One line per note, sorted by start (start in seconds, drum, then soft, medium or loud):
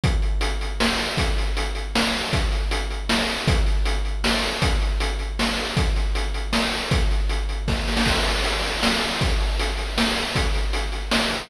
0.04 kick loud
0.04 closed hi-hat loud
0.22 closed hi-hat medium
0.41 closed hi-hat loud
0.61 closed hi-hat medium
0.80 snare loud
0.99 closed hi-hat medium
1.17 kick loud
1.17 closed hi-hat loud
1.38 closed hi-hat medium
1.57 closed hi-hat loud
1.75 closed hi-hat medium
1.95 snare loud
2.14 closed hi-hat medium
2.33 kick loud
2.33 closed hi-hat loud
2.52 closed hi-hat medium
2.71 closed hi-hat loud
2.90 closed hi-hat medium
3.09 snare loud
3.29 closed hi-hat medium
3.48 kick loud
3.48 closed hi-hat loud
3.66 closed hi-hat medium
3.85 closed hi-hat loud
4.05 closed hi-hat medium
4.24 snare loud
4.42 closed hi-hat medium
4.62 kick loud
4.62 closed hi-hat loud
4.81 closed hi-hat medium
5.00 closed hi-hat loud
5.19 closed hi-hat medium
5.39 snare loud
5.58 closed hi-hat medium
5.77 kick loud
5.77 closed hi-hat loud
5.96 closed hi-hat medium
6.15 closed hi-hat loud
6.34 closed hi-hat medium
6.53 snare loud
6.72 closed hi-hat medium
6.91 kick loud
6.91 closed hi-hat loud
7.11 closed hi-hat medium
7.29 closed hi-hat loud
7.49 closed hi-hat medium
7.68 kick loud
7.68 snare medium
7.88 snare medium
7.97 snare loud
8.06 kick loud
8.06 crash loud
8.25 closed hi-hat medium
8.44 closed hi-hat loud
8.64 closed hi-hat medium
8.83 snare loud
9.02 closed hi-hat medium
9.21 kick loud
9.21 closed hi-hat loud
9.40 closed hi-hat medium
9.59 closed hi-hat loud
9.77 closed hi-hat medium
9.98 snare loud
10.16 closed hi-hat medium
10.35 kick loud
10.35 closed hi-hat loud
10.54 closed hi-hat medium
10.73 closed hi-hat loud
10.92 closed hi-hat medium
11.11 snare loud
11.31 closed hi-hat medium